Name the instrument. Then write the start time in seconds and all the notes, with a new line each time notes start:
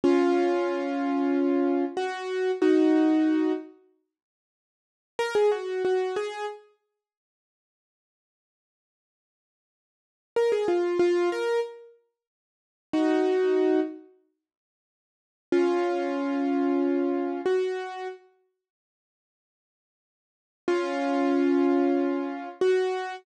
acoustic grand piano
0.04 C#4 F4
1.97 F#4
2.62 D#4 F#4
5.19 A#4
5.35 G#4
5.52 F#4
5.85 F#4
6.16 G#4
10.36 A#4
10.52 G#4
10.68 F4
10.99 F4
11.32 A#4
12.93 D#4 F#4
15.52 C#4 F4
17.46 F#4
20.68 C#4 F4
22.61 F#4